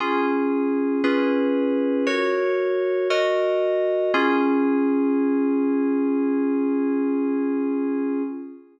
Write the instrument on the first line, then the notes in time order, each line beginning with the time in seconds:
electric piano 2
0.00 C#4 F4 G#4
1.04 C#4 F4 G#4 B4
2.07 F#4 A#4 C#5
3.10 F#4 A#4 D#5
4.14 C#4 F4 G#4